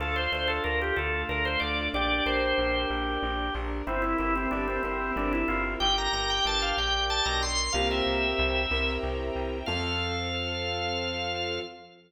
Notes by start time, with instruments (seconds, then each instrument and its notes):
0.00 electric bass (finger) D2, string ensemble 1 D4 F4 A4, acoustic grand piano D4, drawbar organ F4 A4
0.16 drawbar organ C5
0.32 electric bass (finger) D2, acoustic grand piano A4, drawbar organ C5
0.48 drawbar organ A4
0.64 electric bass (finger) D2, acoustic grand piano D4, drawbar organ A#4
0.82 drawbar organ G4
0.96 electric bass (finger) D2, string ensemble 1 A3 D4 A4, acoustic grand piano F4, drawbar organ A4
1.29 electric bass (finger) D2, acoustic grand piano D4, drawbar organ A#4
1.45 drawbar organ C5
1.60 electric bass (finger) D2, acoustic grand piano A4, drawbar organ D5
1.94 electric bass (finger) A#1, acoustic grand piano D4, string ensemble 1 D4 G4 A#4, drawbar organ G4 D5
2.26 electric bass (finger) A#1, acoustic grand piano A#4, drawbar organ C5
2.58 electric bass (finger) A#1, acoustic grand piano D4
2.90 electric bass (finger) A#1, string ensemble 1 D4 A#4 D5, acoustic grand piano G4
3.23 electric bass (finger) A#1, acoustic grand piano D4
3.54 electric bass (finger) A#1, acoustic grand piano A#4
3.87 electric bass (finger) G1, drawbar organ C4 E4, string ensemble 1 C4 E4 G4 A#4, acoustic grand piano C4
4.02 drawbar organ E4
4.18 electric bass (finger) G1, drawbar organ E4, acoustic grand piano E4
4.36 drawbar organ C4
4.51 electric bass (finger) G1, drawbar organ D4, acoustic grand piano G4
4.68 drawbar organ C4
4.83 electric bass (finger) G1, drawbar organ C4, string ensemble 1 C4 E4 A#4 C5, acoustic grand piano A#4
5.16 electric bass (finger) G1, acoustic grand piano C4, drawbar organ D4
5.33 drawbar organ E4
5.48 electric bass (finger) G1, acoustic grand piano E4, drawbar organ F4
5.80 electric bass (finger) G1, string ensemble 1 D4 G4 A#4, drawbar organ G4 G5
5.98 drawbar organ A#5
6.13 electric bass (finger) G1, drawbar organ A#5
6.30 drawbar organ G5
6.45 electric bass (finger) G1, drawbar organ A5
6.62 drawbar organ F5
6.76 electric bass (finger) A#1, string ensemble 1 D4 A#4 D5, drawbar organ G5
7.10 drawbar organ A5
7.25 electric bass (finger) B1, drawbar organ A#5
7.42 drawbar organ C6
7.73 electric bass (finger) C2, drawbar organ A#3 F5, acoustic grand piano C4 F4 G4 A#4, string ensemble 1 C5 F5 G5 A#5
7.91 drawbar organ E5
8.06 electric bass (finger) C2
8.39 electric bass (finger) C2
8.71 electric bass (finger) C2, acoustic grand piano C4 E4 G4 A#4, string ensemble 1 C5 E5 G5 A#5
9.03 electric bass (finger) C2
9.36 electric bass (finger) C2
9.66 electric bass (finger) F2, drawbar organ F3 F5, acoustic grand piano C4 F4 A4, string ensemble 1 C4 F4 A4